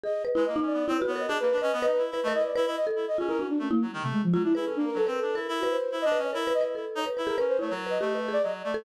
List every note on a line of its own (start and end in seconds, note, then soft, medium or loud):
0.03 0.22 G#4 medium
0.03 0.23 D#5 medium
0.25 0.34 B4 medium
0.35 0.45 G#3 medium
0.35 0.45 E4 medium
0.35 0.44 B4 loud
0.46 0.60 A#3 medium
0.46 0.55 D#5 medium
0.56 0.84 D#4 loud
0.61 0.73 C#4 soft
0.66 0.85 D5 medium
0.73 0.86 B3 medium
0.87 0.97 C4 loud
0.87 1.00 E4 medium
0.87 0.97 C#5 medium
0.98 1.07 B4 medium
1.02 1.14 F#4 loud
1.07 1.26 B3 medium
1.07 1.18 C#5 medium
1.15 1.28 A#4 medium
1.15 1.29 D#5 medium
1.28 1.38 D4 loud
1.28 1.42 G#4 medium
1.28 1.39 D#5 medium
1.40 1.50 A#3 medium
1.40 1.56 A#4 soft
1.40 1.59 B4 loud
1.52 1.61 D4 medium
1.58 1.70 B4 medium
1.58 1.79 D#5 medium
1.62 1.72 C#4 loud
1.73 1.85 B3 loud
1.82 1.98 D#4 medium
1.82 2.01 B4 loud
1.82 1.92 D#5 loud
1.93 2.02 B4 loud
1.98 2.10 E4 medium
2.11 2.20 E4 medium
2.11 2.26 B4 medium
2.23 2.33 A3 loud
2.23 2.33 D#5 medium
2.28 2.40 A#4 loud
2.32 2.51 E4 medium
2.32 2.44 D#5 loud
2.41 2.54 B4 medium
2.41 2.54 D5 medium
2.56 2.65 E4 loud
2.56 2.65 B4 loud
2.66 2.76 E4 loud
2.66 2.75 D#5 medium
2.76 2.86 D#5 loud
2.87 3.06 A4 medium
2.96 3.06 E4 medium
3.08 3.17 D#5 medium
3.18 3.47 C#4 medium
3.18 3.28 F4 medium
3.18 3.28 G#4 medium
3.28 3.38 E4 medium
3.28 3.38 A#4 loud
3.39 3.58 D4 medium
3.39 3.49 F#4 medium
3.49 3.59 D4 medium
3.59 3.68 A3 medium
3.59 3.70 C#4 medium
3.71 3.80 A#3 loud
3.71 3.80 E4 medium
3.82 3.91 F#3 medium
3.91 4.03 D#3 loud
3.91 4.01 G3 medium
4.02 4.12 C3 medium
4.02 4.21 A3 medium
4.12 4.22 G#3 loud
4.23 4.33 F3 loud
4.33 4.42 F#3 medium
4.33 4.44 G#3 medium
4.33 4.43 F4 loud
4.43 4.53 D4 medium
4.43 4.54 E4 loud
4.55 4.65 E4 loud
4.55 4.64 G#4 medium
4.55 4.74 B4 medium
4.65 4.78 C#4 medium
4.65 4.74 A4 medium
4.76 4.90 A#3 medium
4.76 4.85 D4 loud
4.86 4.95 A#4 loud
4.94 5.07 F#3 medium
4.94 5.06 A4 loud
4.94 5.06 B4 medium
5.07 5.19 C4 medium
5.07 5.17 A#4 medium
5.07 5.32 B4 medium
5.18 5.37 A4 medium
5.22 5.35 D4 medium
5.35 5.47 E4 medium
5.35 5.60 A#4 medium
5.48 5.77 E4 loud
5.60 5.69 F#4 medium
5.60 5.88 B4 medium
5.70 5.98 C5 medium
5.92 6.04 E4 medium
6.02 6.18 D4 loud
6.02 6.20 D#5 loud
6.12 6.31 B4 medium
6.18 6.31 C#4 medium
6.23 6.32 C#5 medium
6.33 6.53 E4 loud
6.33 6.42 A#4 medium
6.33 6.45 A#4 soft
6.47 6.60 B4 loud
6.54 6.75 E4 medium
6.54 6.63 D#5 loud
6.61 6.74 B4 medium
6.75 6.85 E4 medium
6.75 7.03 A4 medium
6.95 7.05 D#4 loud
6.95 7.05 C#5 medium
7.06 7.16 B4 medium
7.17 7.36 E4 medium
7.17 7.26 B4 medium
7.27 7.36 G#4 medium
7.27 7.46 A#4 medium
7.38 7.58 C#4 medium
7.38 7.57 B4 loud
7.48 7.58 C5 medium
7.59 7.70 A3 medium
7.59 7.71 E4 medium
7.59 7.69 C#5 medium
7.70 7.98 F#3 medium
7.70 7.85 A#4 medium
7.87 7.99 B4 medium
7.87 8.18 D#5 medium
8.00 8.38 A3 medium
8.00 8.13 G4 medium
8.15 8.27 B4 medium
8.28 8.41 G#4 medium
8.33 8.42 D5 loud
8.43 8.62 F#3 medium
8.43 8.52 D#5 medium
8.64 8.83 A3 medium
8.64 8.73 D5 medium
8.74 8.84 A4 loud